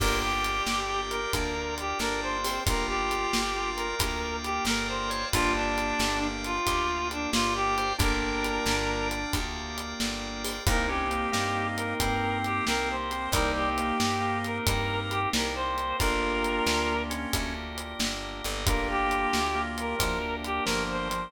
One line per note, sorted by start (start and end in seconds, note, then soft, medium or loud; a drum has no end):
0.00 0.61 G1 loud
0.00 1.19 A#3 loud
0.00 1.19 D4 loud
0.00 1.19 F4 loud
0.00 0.80 G4 medium
0.00 1.19 G4 loud
0.00 0.19 A#4 medium
0.00 2.63 A#4 medium
0.00 2.63 D5 medium
0.00 2.63 F5 medium
0.00 2.63 G5 medium
0.00 kick loud
0.00 crash loud
0.22 1.00 G4 medium
0.44 closed hi-hat medium
0.66 1.26 G1 medium
0.66 snare loud
0.89 1.32 G4 medium
1.10 1.74 A#4 medium
1.10 closed hi-hat medium
1.33 1.94 D2 medium
1.33 2.53 A#3 loud
1.33 1.54 D4 medium
1.33 2.53 D4 loud
1.33 2.53 F4 loud
1.33 2.53 G4 medium
1.33 kick loud
1.33 closed hi-hat loud
1.78 1.98 G4 medium
1.78 closed hi-hat medium
1.99 2.59 G1 medium
1.99 2.38 D4 medium
1.99 2.21 A#4 medium
1.99 snare loud
2.22 2.60 C5 medium
2.44 2.64 C4 medium
2.44 open hi-hat loud
2.66 3.27 G1 medium
2.66 3.86 A#3 loud
2.66 3.86 D4 loud
2.66 3.41 F4 medium
2.66 3.86 F4 loud
2.66 3.86 G4 loud
2.66 5.32 A#4 medium
2.66 2.86 A#4 medium
2.66 5.32 D5 medium
2.66 5.32 F5 loud
2.66 5.32 G5 medium
2.66 kick loud
2.66 closed hi-hat loud
2.88 3.70 G4 medium
3.11 closed hi-hat medium
3.33 3.94 G1 medium
3.33 snare loud
3.56 3.95 F4 medium
3.76 4.36 A#4 medium
3.76 closed hi-hat medium
3.99 4.59 D2 medium
3.99 5.21 A#3 loud
3.99 5.21 D4 medium
3.99 5.21 F4 loud
3.99 5.21 G4 medium
3.99 4.20 A#4 medium
3.99 kick loud
3.99 closed hi-hat loud
4.44 4.64 G4 medium
4.44 closed hi-hat medium
4.65 5.25 G1 medium
4.65 4.87 A#4 medium
4.65 5.10 A#4 medium
4.65 snare loud
4.88 5.25 C5 medium
5.10 5.29 C#5 medium
5.10 closed hi-hat medium
5.32 5.93 G1 loud
5.32 6.54 A#3 loud
5.32 6.54 D4 loud
5.32 6.20 D4 medium
5.32 5.53 F4 medium
5.32 6.54 F4 loud
5.32 6.54 G4 loud
5.32 7.96 A#4 medium
5.32 7.96 D5 medium
5.32 7.96 F5 medium
5.32 7.96 G5 loud
5.32 kick loud
5.32 closed hi-hat loud
5.55 6.27 D4 medium
5.78 closed hi-hat medium
5.99 6.59 G1 medium
5.99 snare loud
6.22 6.58 D4 medium
6.44 7.08 F4 medium
6.44 closed hi-hat medium
6.66 7.27 D2 medium
6.66 7.86 A#3 loud
6.66 7.86 D4 loud
6.66 7.86 F4 medium
6.66 7.86 G4 loud
6.66 6.87 G4 medium
6.66 kick loud
6.66 closed hi-hat loud
7.11 7.30 D4 medium
7.11 closed hi-hat medium
7.33 7.93 G1 medium
7.33 7.54 F4 medium
7.33 7.75 G4 medium
7.33 snare loud
7.55 7.93 G4 medium
7.78 7.97 C5 medium
7.78 closed hi-hat medium
7.98 8.59 G1 loud
7.98 9.19 A#3 loud
7.98 9.39 D4 medium
7.98 9.19 D4 loud
7.98 9.19 F4 loud
7.98 9.19 G4 loud
7.98 9.08 A#4 medium
7.98 10.64 A#4 loud
7.98 10.64 D5 loud
7.98 10.64 F5 medium
7.98 10.64 G5 medium
7.98 kick loud
7.98 closed hi-hat loud
8.44 closed hi-hat loud
8.66 9.26 G1 medium
8.66 snare loud
9.11 closed hi-hat medium
9.33 9.94 D2 medium
9.33 10.54 A#3 loud
9.33 10.54 D4 loud
9.33 10.54 F4 medium
9.33 10.54 G4 loud
9.33 kick loud
9.33 closed hi-hat loud
9.78 closed hi-hat medium
10.00 10.60 G1 medium
10.00 snare loud
10.44 open hi-hat loud
10.66 11.27 C2 loud
10.66 11.98 A#3 medium
10.66 10.87 A#3 medium
10.66 13.07 A#3 loud
10.66 11.98 C4 loud
10.66 13.07 C4 loud
10.66 11.98 D#4 medium
10.66 13.07 D#4 loud
10.66 11.98 G4 medium
10.66 13.07 G4 loud
10.66 10.90 A#4 medium
10.66 kick loud
10.66 closed hi-hat loud
10.87 11.08 C#4 medium
10.87 11.67 G4 medium
11.10 11.30 A#3 medium
11.10 closed hi-hat medium
11.32 11.94 G2 medium
11.32 11.94 A#3 medium
11.32 snare loud
11.76 12.38 A#4 medium
11.76 closed hi-hat medium
12.00 12.61 G2 medium
12.00 13.32 A#3 medium
12.00 12.96 C4 medium
12.00 13.32 C4 loud
12.00 13.32 G4 loud
12.00 13.32 A#4 loud
12.00 kick loud
12.00 closed hi-hat loud
12.44 12.65 G4 medium
12.44 closed hi-hat medium
12.67 13.28 C2 medium
12.67 12.89 A#4 medium
12.67 snare loud
12.90 13.29 C5 medium
13.11 13.33 C4 medium
13.11 closed hi-hat medium
13.32 13.92 C2 loud
13.32 13.69 G3 medium
13.32 14.65 A#3 loud
13.32 15.74 A#3 loud
13.32 14.65 C4 loud
13.32 15.74 C4 loud
13.32 14.65 D#4 medium
13.32 15.74 D#4 loud
13.32 14.65 G4 medium
13.32 15.74 G4 loud
13.32 13.51 A#4 medium
13.32 kick loud
13.32 closed hi-hat loud
13.56 14.38 G4 medium
13.78 13.98 A#3 medium
13.78 closed hi-hat medium
14.00 14.60 G2 medium
14.00 snare loud
14.21 14.57 A#3 medium
14.44 15.00 A#4 medium
14.44 closed hi-hat medium
14.67 15.27 G2 medium
14.67 15.99 A#3 loud
14.67 15.99 C4 medium
14.67 15.99 G4 loud
14.67 15.99 A#4 medium
14.67 15.20 A#4 medium
14.67 kick loud
14.67 closed hi-hat loud
15.11 15.29 G4 medium
15.11 closed hi-hat medium
15.33 15.94 C2 medium
15.33 15.54 A#4 medium
15.33 snare loud
15.55 15.97 C5 loud
15.78 closed hi-hat medium
15.99 16.61 G1 medium
15.99 17.31 A#3 loud
15.99 18.41 A#3 loud
15.99 17.31 D4 medium
15.99 18.41 D4 loud
15.99 16.94 F4 medium
15.99 17.31 F4 loud
15.99 18.41 F4 loud
15.99 17.31 G4 medium
15.99 18.41 G4 loud
15.99 17.02 A#4 loud
15.99 kick loud
15.99 closed hi-hat loud
16.44 closed hi-hat medium
16.66 17.26 D2 medium
16.66 snare loud
17.10 17.54 C#4 medium
17.10 closed hi-hat loud
17.33 17.94 D2 medium
17.33 18.65 A#3 medium
17.33 18.65 D4 medium
17.33 18.65 G4 medium
17.33 18.65 A#4 loud
17.33 kick loud
17.33 closed hi-hat loud
17.78 closed hi-hat medium
17.99 18.42 G1 medium
17.99 snare loud
18.44 19.27 G1 loud
18.44 closed hi-hat medium
18.66 19.98 A#3 medium
18.66 21.06 A#3 loud
18.66 19.40 A#3 medium
18.66 19.98 D4 medium
18.66 21.06 D4 loud
18.66 19.98 F4 medium
18.66 21.06 F4 loud
18.66 19.98 G4 medium
18.66 21.06 G4 loud
18.66 18.88 A#4 medium
18.66 kick loud
18.66 closed hi-hat loud
18.90 19.61 G4 medium
19.11 closed hi-hat medium
19.33 19.94 D2 medium
19.33 snare loud
19.55 19.95 A#3 medium
19.78 20.35 A#4 medium
19.78 closed hi-hat medium
19.99 20.60 D2 medium
19.99 20.19 F3 medium
19.99 21.31 A#3 medium
19.99 21.31 D4 loud
19.99 21.31 G4 medium
19.99 21.31 A#4 medium
19.99 kick loud
19.99 closed hi-hat loud
20.44 20.64 G4 medium
20.44 closed hi-hat medium
20.64 21.28 G1 medium
20.64 21.08 F3 medium
20.64 20.83 A#4 medium
20.64 snare loud
20.91 21.30 C5 medium
21.10 21.29 F3 medium
21.10 closed hi-hat loud